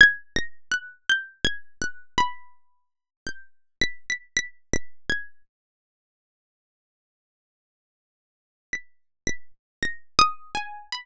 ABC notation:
X:1
M:6/4
L:1/16
Q:1/4=55
K:none
V:1 name="Harpsichord"
(3_a'2 _b'2 _g'2 (3=g'2 a'2 _g'2 =b4 =g'2 =b' b' (3b'2 b'2 a'2 z4 | z8 b'2 b' z (3_b'2 _e'2 _a2 =b4 z4 |]